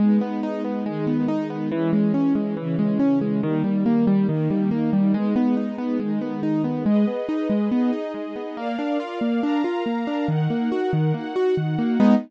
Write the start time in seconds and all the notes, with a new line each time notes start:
0.00 G#3 B3 D#4
0.21 B3
0.43 D#4
0.64 B3
0.86 D#3 G#3 D#4
1.07 B3
1.28 D#4
1.50 B3
1.72 E3 G#3 C#4
1.93 G#3
2.14 C#4
2.35 G#3
2.57 C#3 E3 C#4
2.79 G#3
3.00 C#4
3.21 G#3
3.43 D#3 G3 A#3
3.64 G3
3.86 A#3
4.07 G3
4.28 D#3 A#3 D#4
4.50 G3
4.71 A#3
4.93 G3
5.14 G#3 B3 D#4
5.36 B3
5.57 D#4
5.78 B3
6.00 D#3 G#3 D#4
6.21 B3
6.43 D#4
6.64 B3
6.86 G#3 G#4 B4 D#5
7.08 B3
7.29 D#4
7.50 G#3
7.71 B3 D#4 G#4 D#5
7.93 D#4
8.14 G#3
8.36 B3
8.57 A#3 A#4 D5 F5
8.79 D4
9.00 F4
9.21 A#3
9.43 D4 A#4 F5 A#5
9.64 F4
9.86 A#3
10.07 D4
10.28 D#3 D#4 A#4 F#5
10.50 A#3
10.72 F#4
10.93 D#3
11.14 A#3 D#4 F#4 F#5
11.36 F#4
11.57 D#3
11.78 A#3
12.00 G#3 B3 D#4